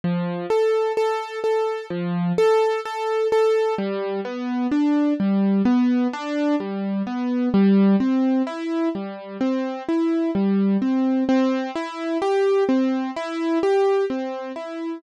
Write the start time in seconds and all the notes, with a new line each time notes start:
0.04 F3
0.50 A4
0.97 A4
1.44 A4
1.90 F3
2.38 A4
2.85 A4
3.32 A4
3.78 G3
4.25 B3
4.71 D4
5.20 G3
5.65 B3
6.13 D4
6.60 G3
7.07 B3
7.54 G3
8.00 C4
8.47 E4
8.95 G3
9.41 C4
9.89 E4
10.35 G3
10.82 C4
11.29 C4
11.76 E4
12.22 G4
12.69 C4
13.16 E4
13.63 G4
14.10 C4
14.56 E4